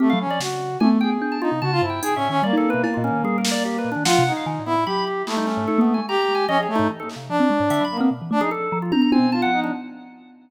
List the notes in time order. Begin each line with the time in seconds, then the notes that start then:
0.00 A3 C4 G4
0.10 F#3 F5
0.20 C#4
0.27 F3 D5
0.40 C#3 F#4, snare
0.80 A3 G#5, high tom
1.01 G#4 G5
1.22 D4
1.32 A5
1.41 D#4 F4
1.52 C3
1.62 C#3 F#4 A5
1.72 F4
1.82 G2 E4
1.90 G5
2.02 D#4 G#4, closed hi-hat
2.16 A2 C#4 E5
2.30 D#3 C#4
2.43 G3 A#3 D5
2.53 D#4
2.57 A4
2.64 high tom
2.70 B4
2.74 B2
2.84 E4, cowbell
2.94 A#2 F4
3.04 C#4
3.11 D#3
3.24 G3 G#4
3.38 A#4
3.45 snare
3.51 D5
3.65 G4
3.78 B4
3.85 A#2
3.92 D4
3.96 D#3
4.05 F3 F4 F#5, snare
4.19 C3
4.27 D#4
4.32 D#4
4.37 F5
4.46 D#3
4.59 A2
4.66 B3 E4
4.73 A2
4.86 F#3 G4 B5
5.07 G4
5.27 A3 A#3 E4, clap
5.37 G3 D#4
5.47 C#4, clap
5.57 G#2
5.68 D#4 A4
5.78 A#3 B3
5.94 G#5
5.98 G#3
6.08 G4 A#5
6.22 A#5
6.29 G#3
6.35 G#5
6.48 F3 C#4 D#5
6.58 G#4
6.63 C#5
6.69 A3
6.76 G#2 D#4
6.90 E3
7.00 A#3 A4
7.09 clap
7.16 C3
7.29 F3 D4
7.40 C4
7.50 G#3
7.60 G#2
7.70 D3 E5, closed hi-hat
7.81 F#3 B5
7.91 A#3
7.97 B3 C4
8.11 B2
8.22 E3
8.31 A3 D4
8.41 F3 D#4 G#4
8.51 A4
8.72 F3
8.82 F4
8.92 D4 A#5, high tom
9.02 A#5
9.11 C4 G#5, high tom
9.19 B2
9.32 F4 A5
9.42 F3 F#5
9.52 D#4
9.64 D4